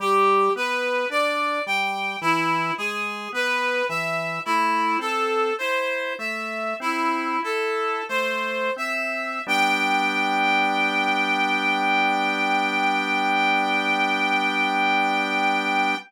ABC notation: X:1
M:4/4
L:1/8
Q:1/4=54
K:G
V:1 name="Clarinet"
G B d g E ^G B e | "^rit." E A c e E A c e | g8 |]
V:2 name="Drawbar Organ"
G, B, D G, E, ^G, B, E, | "^rit." A, C E A, C E A, C | [G,B,D]8 |]